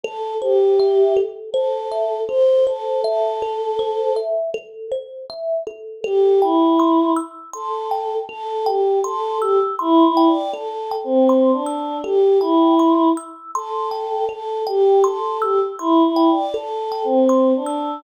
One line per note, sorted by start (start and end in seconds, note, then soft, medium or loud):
0.03 0.34 A4 medium
0.03 0.38 A4 loud
0.42 1.16 G4 medium
0.42 0.75 C5 medium
0.80 1.13 E5 medium
1.17 1.50 A4 medium
1.52 2.20 A4 medium
1.52 1.88 C5 medium
1.92 2.25 E5 medium
2.28 2.63 A4 medium
2.28 2.64 C5 loud
2.66 3.02 A4 medium
2.66 3.01 C5 medium
3.04 4.14 A4 loud
3.04 3.38 E5 medium
3.42 3.76 A4 medium
3.79 4.13 C5 loud
4.16 4.50 E5 medium
4.54 4.88 A4 loud
4.92 5.25 C5 medium
5.30 5.63 E5 medium
5.67 6.01 A4 medium
6.04 6.40 G4 loud
6.04 6.38 A4 loud
6.42 7.10 E4 medium
6.42 6.76 G5 medium
6.80 7.13 C6 medium
7.16 7.50 E6 medium
7.53 8.14 A4 medium
7.53 7.87 C6 medium
7.91 8.25 G5 medium
8.29 8.63 A4 medium
8.29 8.64 A4 loud
8.66 8.99 G4 medium
8.66 9.00 G5 medium
9.04 9.38 A4 loud
9.04 9.38 C6 loud
9.41 9.59 G4 medium
9.41 9.75 E6 medium
9.79 10.04 E4 loud
9.79 10.13 C6 medium
10.05 10.29 E4 medium
10.17 10.51 G5 medium
10.27 10.51 D5 medium
10.52 10.93 A4 medium
10.52 10.87 A4 medium
10.91 11.25 G5 medium
11.04 11.51 C4 medium
11.29 11.63 C6 medium
11.52 11.98 D4 medium
11.66 12.00 E6 medium
12.04 12.38 G4 loud
12.04 12.38 A4 loud
12.40 13.08 E4 medium
12.40 12.75 G5 medium
12.79 13.13 C6 medium
13.17 13.51 E6 medium
13.55 14.26 A4 medium
13.55 13.89 C6 medium
13.91 14.25 G5 medium
14.29 14.63 A4 medium
14.29 14.62 A4 medium
14.67 15.04 G4 loud
14.67 15.00 G5 medium
15.04 15.40 A4 medium
15.04 15.38 C6 medium
15.42 15.60 G4 medium
15.42 15.75 E6 medium
15.79 16.03 E4 medium
15.79 16.13 C6 medium
16.06 16.30 E4 medium
16.16 16.50 G5 medium
16.31 16.55 D5 medium
16.54 16.88 A4 medium
16.54 17.03 A4 loud
16.92 17.25 G5 medium
17.04 17.53 C4 medium
17.29 17.63 C6 medium
17.56 18.00 D4 medium
17.66 18.00 E6 medium